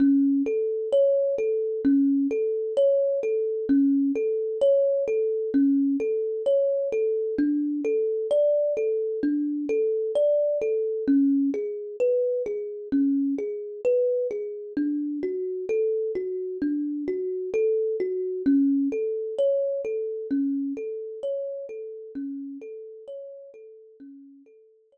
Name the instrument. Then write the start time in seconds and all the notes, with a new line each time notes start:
kalimba
0.00 C#4
0.46 A4
0.93 C#5
1.38 A4
1.85 C#4
2.31 A4
2.77 C#5
3.23 A4
3.69 C#4
4.15 A4
4.61 C#5
5.08 A4
5.54 C#4
6.00 A4
6.46 C#5
6.92 A4
7.38 D4
7.85 A4
8.31 D5
8.77 A4
9.23 D4
9.69 A4
10.15 D5
10.62 A4
11.08 C#4
11.54 G#4
12.00 B4
12.46 G#4
12.92 C#4
13.38 G#4
13.85 B4
14.31 G#4
14.77 D4
15.23 F#4
15.69 A4
16.15 F#4
16.62 D4
17.08 F#4
17.54 A4
18.00 F#4
18.46 C#4
18.92 A4
19.38 C#5
19.85 A4
20.31 C#4
20.77 A4
21.23 C#5
21.69 A4
22.15 C#4
22.62 A4
23.08 C#5
23.54 A4
24.00 C#4
24.46 A4
24.92 C#5